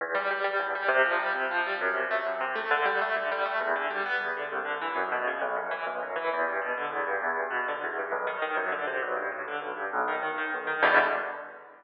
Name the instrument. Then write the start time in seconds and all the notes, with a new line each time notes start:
acoustic grand piano
0.01 E2
0.15 G3
0.31 G3
0.44 G3
0.60 E2
0.75 G3
0.88 C3
1.06 F3
1.19 G3
1.35 C3
1.51 F3
1.66 G3
1.81 F#2
1.94 C3
2.11 A3
2.26 F#2
2.41 C3
2.56 A3
2.71 D3
2.85 G3
3.01 A3
3.16 D3
3.32 G3
3.46 A3
3.61 E2
3.76 D3
3.90 G3
4.06 B3
4.21 E2
4.37 D3
4.52 C2
4.65 D3
4.81 E3
4.95 F#2
5.12 B2
5.27 C#3
5.41 B1
5.56 F#2
5.71 E3
5.86 B1
6.03 F#2
6.16 E3
6.33 E2
6.47 G2
6.62 B2
6.78 D3
6.91 E2
7.07 G2
7.22 E2
7.36 G2
7.50 B2
7.68 D3
7.84 E2
7.99 G2
8.12 B1
8.27 D#3
8.42 D#3
8.57 F#2
8.72 D3
8.87 C3
9.02 B1
9.17 G2
9.32 A2
9.48 D3
9.61 B1
9.77 G2
9.93 B1
10.08 D#3
10.23 D#3
10.38 D#3
10.54 B1
10.67 D#3
10.83 E2 B2 D3 G3